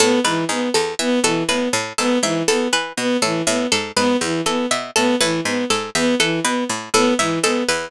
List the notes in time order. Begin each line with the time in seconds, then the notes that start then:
0.00 A2 B3 A4
0.24 G#2 E3 B4
0.49 G#2 B3
0.74 E2 A4
0.99 E3 B3 E5
1.24 B2 E3 A4
1.49 A2 B3 B4
1.73 A2
1.98 G#2 B3 A4
2.23 G#2 E3 E5
2.48 E2 B3 A4
2.73 E3 B4
2.97 B2 B3
3.22 A2 E3 A4
3.47 A2 B3 E5
3.72 G#2 A4
3.96 G#2 B3 B4
4.21 E2 E3
4.46 E3 B3 A4
4.71 B2 E5
4.96 A2 B3 A4
5.21 A2 E3 B4
5.45 G#2 B3
5.70 G#2 A4
5.95 E2 B3 E5
6.20 E3 A4
6.44 B2 B3 B4
6.69 A2
6.94 A2 B3 A4
7.19 G#2 E3 E5
7.43 G#2 B3 A4
7.68 E2 B4